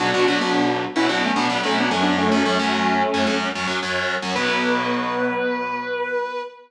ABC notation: X:1
M:4/4
L:1/16
Q:1/4=110
K:Bm
V:1 name="Distortion Guitar"
[DF]2 [DF] [B,D]3 z [CE] [DF] [A,C] [B,D]2 [A,C] [B,D] [A,C] [B,D] | [A,C]10 z6 | B16 |]
V:2 name="Overdriven Guitar"
[B,,F,B,] [B,,F,B,] [B,,F,B,] [B,,F,B,]4 [B,,F,B,] [B,,F,B,]2 [B,,F,B,] [B,,F,B,] [B,,F,B,]2 [F,,F,C]2- | [F,,F,C] [F,,F,C] [F,,F,C] [F,,F,C]4 [F,,F,C] [F,,F,C]2 [F,,F,C] [F,,F,C] [F,,F,C]3 [F,,F,C] | [B,,F,B,]16 |]